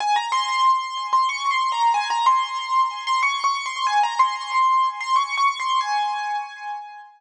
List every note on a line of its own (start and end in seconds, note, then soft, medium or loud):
0.00 0.16 G#5 loud
0.16 0.31 A#5 medium
0.32 1.06 C6 loud
1.13 1.28 C6 medium
1.29 1.49 C#6 medium
1.51 1.71 C6 medium
1.72 1.92 A#5 medium
1.94 2.09 G#5 loud
2.10 2.26 A#5 loud
2.26 3.03 C6 medium
3.07 3.22 C6 medium
3.23 3.43 C#6 medium
3.44 3.64 C#6 medium
3.66 3.86 C6 medium
3.87 4.02 G#5 medium
4.03 4.19 A#5 medium
4.19 4.89 C6 medium
5.01 5.16 C6 medium
5.16 5.36 C#6 medium
5.37 5.58 C#6 medium
5.60 5.80 C6 medium
5.81 7.00 G#5 loud